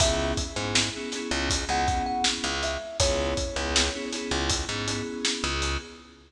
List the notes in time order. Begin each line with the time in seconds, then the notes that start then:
0.00 C#2 B3 C#4 E4 G#4 E5, kick, closed hi-hat
0.37 kick, closed hi-hat
0.55 G#2 B3 C#4 E4 G#4
0.75 snare
0.95 B3 C#4 E4 G#4
1.12 B3 C#4 E4 G#4, snare, closed hi-hat
1.31 C#2
1.50 kick, closed hi-hat
1.68 C#2 B3 C#4 E4 G#4 F#5
1.87 B3 C#4 E4 G#4, kick, closed hi-hat
2.06 F#5
2.24 snare
2.44 C#2
2.63 E5, closed hi-hat
3.00 C#2 B3 C#4 E4 G#4 C#5, kick, closed hi-hat
3.37 kick, closed hi-hat
3.55 C#2 B3 C#4 E4 G#4
3.76 snare
3.94 B3 C#4 E4 G#4
4.12 B3 C#4 E4 G#4, snare, closed hi-hat
4.31 C#2
4.50 kick, closed hi-hat
4.69 G#2 B3 C#4 E4 G#4
4.87 B3 C#4 E4 G#4, closed hi-hat
5.25 snare
5.44 C#2
5.62 closed hi-hat